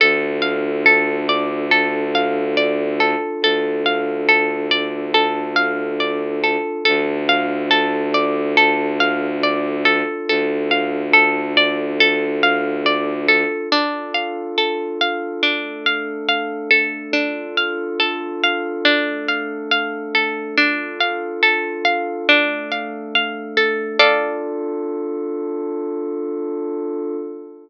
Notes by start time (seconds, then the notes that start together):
0.00 D2 D4 F4 A4
0.42 F5
0.86 A4
1.29 D5
1.71 A4
2.15 F5
2.57 D5
3.00 A4
3.42 D2 A4
3.86 F5
4.29 A4
4.71 D5
5.14 A4
5.56 F5
6.00 D5
6.44 A4
6.85 D2 D4 F4 A4
7.29 F5
7.71 A4
8.14 D5
8.57 A4
9.00 F5
9.43 D5
9.85 A4
10.28 D2 A4
10.71 F5
11.13 A4
11.57 D5
12.00 A4
12.43 F5
12.86 D5
13.28 A4
13.72 D4 F4 A4
14.14 F5
14.58 A4
15.01 F5
15.43 A3 D4 A4
15.86 F5
16.29 F5
16.71 A4
17.13 D4 F4 A4
17.57 F5
18.00 A4
18.44 F5
18.85 A3 D4 A4
19.28 F5
19.71 F5
20.15 A4
20.56 D4 F4 A4
21.00 F5
21.43 A4
21.85 F5
22.27 A3 D4 A4
22.72 F5
23.15 F5
23.57 A4
23.99 D4 F4 A4 D5 F5